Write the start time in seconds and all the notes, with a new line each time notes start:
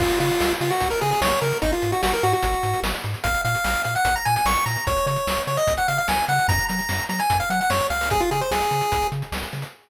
0.00 C#2 F4, kick, crash
0.10 closed hi-hat
0.20 C#3 F4, closed hi-hat
0.30 closed hi-hat
0.40 C#2, snare
0.51 closed hi-hat
0.61 C#3 F4, closed hi-hat
0.71 F#4, closed hi-hat
0.80 C#2, kick, closed hi-hat
0.90 A#4, closed hi-hat
1.01 C#3 G#4, closed hi-hat
1.11 G#4, closed hi-hat
1.21 C#2 C#5, snare
1.32 closed hi-hat
1.41 C#3 A#4, snare, closed hi-hat
1.52 closed hi-hat
1.62 G#1 D#4, kick, closed hi-hat
1.72 F4, closed hi-hat
1.82 G#2, closed hi-hat
1.92 F#4, closed hi-hat
2.03 G#1 F#4, snare
2.13 A#4, closed hi-hat
2.23 G#2 F#4, closed hi-hat
2.33 F#4, closed hi-hat
2.43 G#1, kick, closed hi-hat
2.53 closed hi-hat
2.63 G#2, closed hi-hat
2.73 closed hi-hat
2.83 G#1, snare
2.94 closed hi-hat
3.04 G#2, snare, closed hi-hat
3.14 closed hi-hat
3.24 A#1 F5, kick, closed hi-hat
3.34 closed hi-hat
3.45 A#2 F5, closed hi-hat
3.55 closed hi-hat
3.64 A#1, snare
3.75 closed hi-hat
3.84 A#2 F5, closed hi-hat
3.95 F#5, closed hi-hat
4.05 A#1, kick, closed hi-hat
4.16 A#5, closed hi-hat
4.25 A#2 G#5, closed hi-hat
4.36 G#5, closed hi-hat
4.45 A#1 C#6, snare
4.56 closed hi-hat
4.66 A#2 A#5, snare, closed hi-hat
4.76 closed hi-hat
4.87 C#2 C#5, kick, closed hi-hat
4.97 closed hi-hat
5.06 C#3 C#5, closed hi-hat
5.16 closed hi-hat
5.27 C#2, snare
5.37 closed hi-hat
5.47 C#3 C#5, closed hi-hat
5.57 D#5, closed hi-hat
5.67 C#2, kick, closed hi-hat
5.77 F#5, closed hi-hat
5.88 C#3 F5, closed hi-hat
5.98 F5, closed hi-hat
6.08 C#2 G#5, snare
6.17 closed hi-hat
6.28 C#3 F#5, snare, closed hi-hat
6.39 closed hi-hat
6.48 F#2 A#5, kick, closed hi-hat
6.59 closed hi-hat
6.69 F#3 A#5, closed hi-hat
6.79 closed hi-hat
6.89 F#2, snare
6.99 closed hi-hat
7.09 F#3 A#5, closed hi-hat
7.19 G#5, closed hi-hat
7.30 F#2, kick, closed hi-hat
7.40 F5, closed hi-hat
7.50 F#3 F#5, closed hi-hat
7.61 F#5, closed hi-hat
7.70 F#2 C#5, snare
7.80 closed hi-hat
7.90 C#2 F5, snare, closed hi-hat
8.01 open hi-hat
8.10 G#4, kick, closed hi-hat
8.20 F4, closed hi-hat
8.31 C#3 G#4, closed hi-hat
8.41 C5, closed hi-hat
8.51 C#2 G#4, snare
8.62 closed hi-hat
8.71 C#3, closed hi-hat
8.81 closed hi-hat
8.92 C#2, kick, closed hi-hat
9.02 closed hi-hat
9.12 C#3, closed hi-hat
9.22 closed hi-hat
9.32 C#2, snare
9.43 closed hi-hat
9.53 C#3, snare, closed hi-hat
9.62 closed hi-hat